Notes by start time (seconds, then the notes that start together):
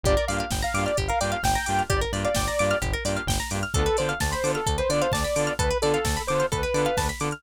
0.03 G1 A#3 D4 F4 G4 D5, kick, closed hi-hat
0.17 A#4, closed hi-hat
0.28 G2 A#3 D4 F4 G4 D5 F5, open hi-hat
0.38 F5, closed hi-hat
0.50 G1 G5, kick, snare
0.62 F5 A#5, closed hi-hat
0.74 G2 A#3 D4 F4 G4 D6, open hi-hat
0.86 D5 F6, closed hi-hat
0.97 G1 G4, kick, closed hi-hat
1.08 A#4 F5, closed hi-hat
1.20 G2 A#3 D4 F4 G4 D5 G5, open hi-hat
1.32 F5, closed hi-hat
1.43 G1 G5, kick, snare
1.55 A#5, closed hi-hat
1.66 G2 A#3 D4 F4 G4 D6, open hi-hat
1.79 F6, closed hi-hat
1.89 G1 G4 D5, kick, closed hi-hat
2.01 A#4, closed hi-hat
2.13 G2 A#3 D4 F4 G4 D5, open hi-hat
2.25 D5 F5, closed hi-hat
2.35 G1 G5, kick, snare
2.48 A#5, closed hi-hat
2.59 G2 A#3 D4 F4 G4 D6, open hi-hat
2.70 F6, closed hi-hat
2.82 G1 G4, kick, closed hi-hat
2.93 A#4, closed hi-hat
3.05 G2 A#3 D4 F4 G4 D5, open hi-hat
3.17 F5, closed hi-hat
3.26 G1 G5, kick, snare
3.40 A#5, closed hi-hat
3.50 G2 A#3 D4 F4 G4 D6, open hi-hat
3.63 F6, closed hi-hat
3.74 D2 B3 D4 F4 A4, kick, closed hi-hat
3.86 B4, closed hi-hat
3.97 D3 B3 D4 F4 A4 C5 D5, open hi-hat
4.09 F5, closed hi-hat
4.20 D2 A5, kick, snare
4.31 C5 B5, closed hi-hat
4.43 D3 B3 D4 F4 A4 D6, open hi-hat
4.54 A4 F6, closed hi-hat
4.66 D2 A4, kick, closed hi-hat
4.78 B4 C5, closed hi-hat
4.89 D3 B3 D4 F4 A4 D5, open hi-hat
5.02 C5 F5, closed hi-hat
5.12 D2 D5 A5, kick, snare
5.24 B5, closed hi-hat
5.36 D3 B3 D4 F4 A4 D6, open hi-hat
5.47 F6, closed hi-hat
5.59 D2 A4 B4, kick, closed hi-hat
5.70 B4, closed hi-hat
5.82 D3 B3 D4 F4 A4 D5, open hi-hat
5.94 F5, closed hi-hat
6.05 D2 A5, kick, snare
6.17 B5, closed hi-hat
6.27 D3 B3 D4 F4 A4 C5 D6, open hi-hat
6.40 F6, closed hi-hat
6.52 D2 A4 B4, kick, closed hi-hat
6.63 B4, closed hi-hat
6.74 D3 B3 D4 F4 A4 D5, open hi-hat
6.85 F5, closed hi-hat
6.97 D2 A5, kick, snare
7.09 B5, closed hi-hat
7.20 D3 B3 D4 F4 A4 D6, open hi-hat
7.31 F6, closed hi-hat